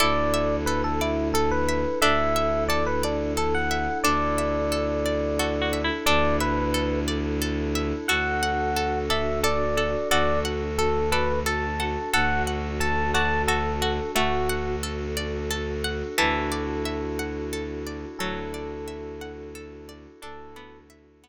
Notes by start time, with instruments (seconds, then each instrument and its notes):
0.00 violin D2, pad 5 (bowed) D4 E4 A4, harpsichord E4, orchestral harp A4, electric piano 1 D5
0.34 orchestral harp E5
0.66 orchestral harp A4, electric piano 1 B4
0.84 electric piano 1 A4
1.01 electric piano 1 E4, orchestral harp D5
1.34 electric piano 1 A4, orchestral harp A4
1.51 electric piano 1 B4
1.69 orchestral harp E5
2.02 violin D2, harpsichord D4, pad 5 (bowed) D4 E4 A4, orchestral harp A4, electric piano 1 E5
2.36 orchestral harp E5
2.69 orchestral harp A4, electric piano 1 D5
2.87 electric piano 1 B4
3.03 electric piano 1 D4, orchestral harp D5
3.37 orchestral harp A4, electric piano 1 A4
3.54 electric piano 1 F#5
3.71 orchestral harp E5
4.04 violin D2, harpsichord D4, pad 5 (bowed) D4 E4 A4, orchestral harp A4, electric piano 1 D5
4.38 orchestral harp E5
4.72 orchestral harp A4
5.06 orchestral harp D5
5.39 harpsichord F#4, orchestral harp A4
5.62 harpsichord F#4
5.73 orchestral harp E5
5.84 harpsichord E4
6.06 violin D2, pad 5 (bowed) D4 E4 A4, harpsichord D4, orchestral harp A4, electric piano 1 D5
6.40 electric piano 1 B4, orchestral harp E5
6.74 orchestral harp A4
7.08 orchestral harp D5
7.42 orchestral harp A4
7.75 orchestral harp E5
8.08 violin D2, pad 5 (bowed) D4 F#4 A4, harpsichord F#4, orchestral harp A4, electric piano 1 F#5
8.43 orchestral harp F#5
8.76 orchestral harp A4
9.10 harpsichord A4, orchestral harp D5, electric piano 1 E5
9.43 harpsichord A4, orchestral harp A4, electric piano 1 D5
9.77 harpsichord A4, orchestral harp F#5
10.11 violin D2, pad 5 (bowed) D4 F#4 A4, harpsichord F#4, orchestral harp A4, electric piano 1 D5
10.45 orchestral harp F#5
10.78 electric piano 1 A4, orchestral harp A4
11.12 harpsichord A4, electric piano 1 B4, orchestral harp D5
11.46 orchestral harp A4, harpsichord A4, electric piano 1 A5
11.80 harpsichord A4, orchestral harp F#5
12.13 violin D2, pad 5 (bowed) D4 F#4 A4, harpsichord A4, orchestral harp A4, electric piano 1 F#5
12.47 orchestral harp F#5
12.80 orchestral harp A4, electric piano 1 A5
13.14 harpsichord F#4, orchestral harp D5, electric piano 1 A5
13.48 harpsichord F#4, electric piano 1 A4, orchestral harp A4
13.82 harpsichord F#4, orchestral harp F#5
14.15 violin D2, harpsichord A3, pad 5 (bowed) D4 F#4 A4, electric piano 1 F#4, orchestral harp A4
14.49 orchestral harp F#5
14.83 orchestral harp A4
15.17 orchestral harp D5
15.51 orchestral harp A4
15.84 orchestral harp F#5
16.18 violin D2, harpsichord E3, pad 5 (bowed) D4 E4 F#4 A4, orchestral harp A4, electric piano 1 A4
16.52 orchestral harp D5
16.85 orchestral harp E5
17.19 orchestral harp F#5
17.53 orchestral harp A4
17.87 orchestral harp D5
18.19 violin D2, harpsichord F#3, pad 5 (bowed) D4 E4 F#4 A4, electric piano 1 A4, orchestral harp A4
18.54 orchestral harp D5
18.88 orchestral harp E5
19.21 orchestral harp F#5
19.55 orchestral harp A4
19.89 orchestral harp D5
20.22 violin D2, harpsichord D4, pad 5 (bowed) D4 E4 F#4 A4, orchestral harp A4, electric piano 1 A4
20.56 harpsichord B3, orchestral harp D5
20.90 orchestral harp E5
21.24 harpsichord B3, orchestral harp F#5